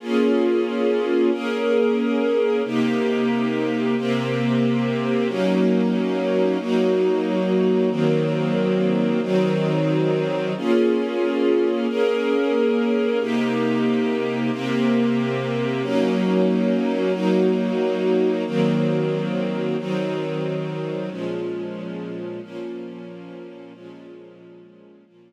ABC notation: X:1
M:4/4
L:1/8
Q:1/4=91
K:Bbm
V:1 name="String Ensemble 1"
[B,DFA]4 [B,DAB]4 | [C,B,E=G]4 [C,B,CG]4 | [G,B,DE]4 [G,B,EG]4 | [E,G,B,C]4 [E,G,CE]4 |
[B,DFA]4 [B,DAB]4 | [C,B,E=G]4 [C,B,CG]4 | [G,B,DE]4 [G,B,EG]4 | [E,G,B,C]4 [E,G,CE]4 |
[B,,F,A,D]4 [B,,F,B,D]4 | [B,,F,A,D]4 [B,,F,B,D]4 |]